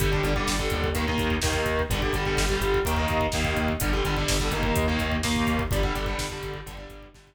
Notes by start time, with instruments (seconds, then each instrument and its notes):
0.00 synth bass 1 G1, overdriven guitar D3 G3, kick, closed hi-hat
0.12 overdriven guitar D3 G3, kick
0.23 synth bass 1 G1, overdriven guitar D3 G3, kick, closed hi-hat
0.36 overdriven guitar D3 G3, kick
0.47 synth bass 1 G1, kick, snare
0.59 overdriven guitar D3 G3, kick
0.70 synth bass 1 D#2, kick, closed hi-hat
0.84 kick
0.95 overdriven guitar D#3 A#3, kick, closed hi-hat
1.07 overdriven guitar D#3 A#3, kick
1.18 synth bass 1 D#2, kick, closed hi-hat
1.30 kick
1.42 synth bass 1 D#2, overdriven guitar D#3 A#3, kick, snare
1.53 kick
1.66 synth bass 1 D#2, kick, closed hi-hat
1.79 kick
1.90 synth bass 1 G1, overdriven guitar D3 G3, kick, closed hi-hat
2.02 overdriven guitar D3 G3, kick
2.13 synth bass 1 G1, overdriven guitar D3 G3, kick, closed hi-hat
2.25 overdriven guitar D3 G3, kick
2.37 synth bass 1 G1, kick, snare
2.49 overdriven guitar D3 G3, kick
2.61 synth bass 1 G1, kick, closed hi-hat
2.74 kick
2.85 synth bass 1 D#2, overdriven guitar D#3 A#3, kick, closed hi-hat
2.97 overdriven guitar D#3 A#3, kick
3.08 synth bass 1 D#2, kick, closed hi-hat
3.21 kick
3.32 synth bass 1 D#2, overdriven guitar D#3 A#3, kick, snare
3.45 kick
3.57 synth bass 1 D#2, kick, closed hi-hat
3.68 kick
3.80 synth bass 1 G1, overdriven guitar D3 G3, kick, closed hi-hat
3.93 overdriven guitar D3 G3, kick
4.04 synth bass 1 G1, overdriven guitar D3 G3, kick, closed hi-hat
4.16 overdriven guitar D3 G3, kick
4.28 synth bass 1 G1, kick, snare
4.40 overdriven guitar D3 G3, kick
4.51 synth bass 1 G1, overdriven guitar D#3 A#3, kick, closed hi-hat
4.63 kick
4.76 synth bass 1 D#2, kick, closed hi-hat
4.88 overdriven guitar D#3 A#3, kick
4.99 synth bass 1 D#2, kick, closed hi-hat
5.12 kick
5.23 synth bass 1 D#2, overdriven guitar D#3 A#3, kick, snare
5.36 kick
5.47 synth bass 1 D#2, kick, closed hi-hat
5.59 kick
5.71 synth bass 1 G1, overdriven guitar D3 G3, kick, closed hi-hat
5.83 overdriven guitar D3 G3, kick
5.95 synth bass 1 G1, overdriven guitar D3 G3, kick, closed hi-hat
6.06 overdriven guitar D3 G3, kick
6.18 synth bass 1 G1, kick, snare
6.30 overdriven guitar D3 G3, kick
6.43 synth bass 1 G1, kick, closed hi-hat
6.54 kick
6.66 synth bass 1 G1, overdriven guitar D3 G3, kick, closed hi-hat
6.77 overdriven guitar D3 G3, kick
6.90 synth bass 1 G1, kick, closed hi-hat
7.02 kick
7.14 synth bass 1 G1, overdriven guitar D3 G3, kick, snare
7.27 kick